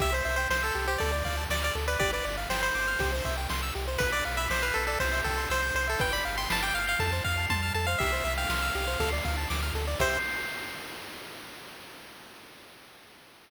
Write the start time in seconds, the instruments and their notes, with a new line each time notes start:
0.00 synth bass 1 C2, lead 1 (square) G4 E5, kick, ride
0.12 lead 1 (square) C5
0.25 synth bass 1 C2, lead 1 (square) E5, ride
0.36 lead 1 (square) C5 G5
0.50 synth bass 1 C2, lead 1 (square) C5 C6, snare
0.63 lead 1 (square) A4 E6
0.74 synth bass 1 C2, lead 1 (square) G4, ride
0.87 lead 1 (square) G4 C5
0.98 synth bass 1 D2, lead 1 (square) A4 D5, kick, ride
1.12 lead 1 (square) D5
1.25 synth bass 1 D2, lead 1 (square) F5, kick, ride
1.37 lead 1 (square) A5
1.49 synth bass 1 D2, lead 1 (square) D5 D6, snare
1.62 lead 1 (square) D5 F6
1.75 synth bass 1 D2, lead 1 (square) A4, ride
1.88 lead 1 (square) B4 D5
1.99 synth bass 1 G1, lead 1 (square) G4 D5, kick, ride
2.13 lead 1 (square) B4 D5
2.25 synth bass 1 G1, lead 1 (square) D5, ride
2.37 lead 1 (square) F5
2.49 synth bass 1 G1, lead 1 (square) C5 G5, snare
2.62 lead 1 (square) C5 B5
2.74 synth bass 1 G1, lead 1 (square) D6, ride
2.88 lead 1 (square) F6
2.99 synth bass 1 C2, lead 1 (square) G4, kick, ride
3.12 lead 1 (square) C5
3.25 synth bass 1 C2, lead 1 (square) E5, kick, ride
3.37 lead 1 (square) G5
3.49 synth bass 1 C2, lead 1 (square) C6, snare
3.63 lead 1 (square) E6
3.75 synth bass 1 C2, lead 1 (square) G4, ride
3.88 lead 1 (square) C5
3.98 synth bass 1 B1, lead 1 (square) B4, kick, ride
4.12 lead 1 (square) D5
4.23 synth bass 1 B1, lead 1 (square) F5, ride
4.37 lead 1 (square) E5 B5
4.50 synth bass 1 B1, lead 1 (square) C5 D6, snare
4.62 lead 1 (square) B4 F6
4.74 synth bass 1 B1, lead 1 (square) A4 B4, ride
4.87 lead 1 (square) A4 D5
5.00 synth bass 1 C2, lead 1 (square) C5, kick, ride
5.13 lead 1 (square) E5
5.24 synth bass 1 C2, lead 1 (square) A4 G5, kick, ride
5.38 lead 1 (square) C6
5.50 synth bass 1 C2, lead 1 (square) C5 E6, snare
5.62 lead 1 (square) G6
5.74 synth bass 1 C2, lead 1 (square) C5, ride
5.88 lead 1 (square) A4 E5
5.99 synth bass 1 G1, lead 1 (square) B4 G5, kick, ride
6.13 lead 1 (square) D5 B5
6.25 synth bass 1 G1, lead 1 (square) F5, ride
6.37 lead 1 (square) G5 C6
6.50 synth bass 1 G1, lead 1 (square) A5 B5, snare
6.62 lead 1 (square) G5 D6
6.74 synth bass 1 G1, lead 1 (square) F5 F6, ride
6.87 lead 1 (square) F5 G6
6.99 synth bass 1 F2, lead 1 (square) A4 A5, kick, ride
7.12 lead 1 (square) C5
7.24 synth bass 1 F2, lead 1 (square) F5, kick, ride
7.37 lead 1 (square) A5
7.50 synth bass 1 F2, lead 1 (square) A5 C6, kick, high tom
7.63 lead 1 (square) F6
7.74 synth bass 1 F2, lead 1 (square) A4 A5
7.86 lead 1 (square) C5 F5
7.98 synth bass 1 C2, lead 1 (square) G4 E5, kick, crash
8.12 lead 1 (square) C5
8.24 synth bass 1 C2, lead 1 (square) E5, ride
8.37 lead 1 (square) F5 G5
8.49 synth bass 1 C2, lead 1 (square) C6, snare
8.62 lead 1 (square) E6
8.75 synth bass 1 C2, lead 1 (square) G4, ride
8.88 lead 1 (square) C5
9.00 synth bass 1 D2, lead 1 (square) A4, kick, ride
9.12 lead 1 (square) D5
9.25 synth bass 1 D2, lead 1 (square) F5, kick, ride
9.38 lead 1 (square) A5
9.50 synth bass 1 D2, lead 1 (square) D6, snare
9.62 lead 1 (square) F6
9.74 synth bass 1 D2, lead 1 (square) A4, ride
9.87 lead 1 (square) D5
9.99 synth bass 1 C2, lead 1 (square) G4 C5 E5, kick, crash